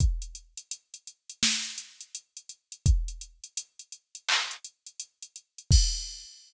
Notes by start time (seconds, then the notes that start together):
0.00 kick, closed hi-hat
0.22 closed hi-hat
0.35 closed hi-hat
0.57 closed hi-hat
0.71 closed hi-hat
0.94 closed hi-hat
1.07 closed hi-hat
1.30 closed hi-hat
1.43 snare
1.65 closed hi-hat
1.78 closed hi-hat
2.01 closed hi-hat
2.15 closed hi-hat
2.37 closed hi-hat
2.49 closed hi-hat
2.72 closed hi-hat
2.86 kick, closed hi-hat
3.08 closed hi-hat
3.21 closed hi-hat
3.44 closed hi-hat
3.57 closed hi-hat
3.79 closed hi-hat
3.92 closed hi-hat
4.15 closed hi-hat
4.29 clap
4.51 closed hi-hat
4.65 closed hi-hat
4.86 closed hi-hat
5.00 closed hi-hat
5.22 closed hi-hat
5.36 closed hi-hat
5.58 closed hi-hat
5.71 kick, crash